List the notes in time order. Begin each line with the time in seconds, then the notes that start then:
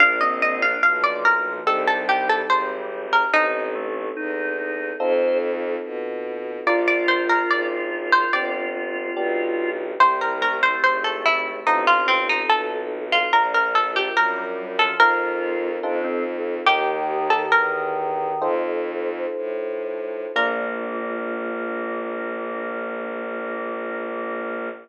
0.00 A#1 A#3 D4 F4 F5
0.21 C4 D#5
0.41 C4 D#5
0.62 D4 F5
0.83 B1 F3 F5
1.04 D5
1.25 A#4
1.46 F3
1.66 C2 G3 C4 D#4 G4 A4
1.87 A4
2.09 G4
2.30 A4
2.49 G#1 C5
3.13 A#4
3.34 A1 C4 D#4 A4
3.75 A3
4.16 E2 D#4
4.58 D#4
5.00 F2 C4 D#4 F4 A4 C5
5.84 B2
6.66 A#1 D4 F4 A#4 D5
6.88 D5
7.08 C5
7.30 A#4
7.49 G#1 D5
8.12 C5
8.33 G1 C4 D4 G4 D5
9.16 B1 B3 D4 G4
10.00 C2 G3 C4 E4 G4 C5
10.21 A#4
10.42 A3 A#4
10.63 C5
10.84 G#1 C5
11.04 A4
11.26 E4
11.66 A1 C4 D#4 F4 A4
11.87 F4
12.08 C4
12.29 D#4
12.49 B1 A4
13.12 F4
13.33 A#1 D4 F4 A#4
13.54 A#4
13.75 A4
13.96 G4
14.16 F#2 G3 A#4
14.37 G3
14.58 G3
14.79 F3 A4
15.00 F2 C4 D#4 F4 A#4
15.83 F2 C4 D4 D#4 F4 A4
16.04 C4
16.66 D#2 D#3 D#4 G4 A#4
17.30 A4
17.51 E2 A#4
18.41 F2 D#4 F4 A4 C5
19.36 A2
20.35 A#1 A#3 D4 F4 A#4